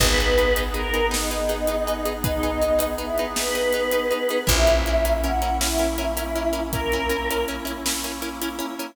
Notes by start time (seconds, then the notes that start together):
0.00 G#1 B3 D#4 G#4 B4, kick, crash
0.17 D#4 G#4 B4, closed hi-hat
0.38 D#4 G#4 B4, closed hi-hat
0.56 D#4 G#4 B4, closed hi-hat
0.74 D#4 G#4 A#4 B4, closed hi-hat
0.94 D#4 G#4 B4, closed hi-hat
1.11 D#4 G#4 B4, snare
1.31 D#4 G#4 B4, closed hi-hat
1.49 D#4 G#4 B4, closed hi-hat
1.67 D#4 G#4 B4, closed hi-hat
1.87 D#4 G#4 B4, closed hi-hat
2.05 D#4 G#4 B4, closed hi-hat
2.24 D#4 G#4 B4, kick, closed hi-hat
2.43 D#4 G#4 B4, closed hi-hat
2.62 D#4 G#4 B4, closed hi-hat
2.79 D#4 G#4 B4, closed hi-hat
2.98 D#4 E4 G#4 B4, closed hi-hat
3.18 D#4 G#4 B4, closed hi-hat
3.36 D#4 G#4 B4, snare
3.55 D#4 G#4 B4, closed hi-hat
3.73 D#4 G#4 B4, closed hi-hat
3.91 D#4 G#4 B4, closed hi-hat
4.11 D#4 G#4 B4, closed hi-hat
4.29 D#4 G#4 B4, closed hi-hat
4.47 A#1 A#3 C#4 E4 A#4 E5, kick, closed hi-hat
4.67 C#4 E4 A#4, closed hi-hat
4.86 C#4 E4 A#4, closed hi-hat
5.05 C#4 E4 A#4, closed hi-hat
5.23 C#4 E4 A#4 F#5, closed hi-hat
5.42 C#4 E4 A#4, closed hi-hat
5.61 C#4 E4 A#4, snare
5.79 C#4 E4 A#4, closed hi-hat
5.98 C#4 E4 A#4, closed hi-hat
6.17 C#4 E4 A#4, closed hi-hat
6.36 C#4 E4 A#4, closed hi-hat
6.53 C#4 E4 A#4, closed hi-hat
6.73 C#4 E4 A#4, kick, closed hi-hat
6.92 C#4 E4 A#4, closed hi-hat
7.09 C#4 E4 A#4, closed hi-hat
7.31 C#4 E4 A#4, closed hi-hat
7.48 C#4 E4 A#4, closed hi-hat
7.65 C#4 E4 A#4, closed hi-hat
7.86 C#4 E4 A#4, snare
8.04 C#4 E4 A#4, closed hi-hat
8.22 C#4 E4 A#4, closed hi-hat
8.42 C#4 E4 A#4, closed hi-hat
8.59 C#4 E4 A#4, closed hi-hat
8.79 C#4 E4 A#4, closed hi-hat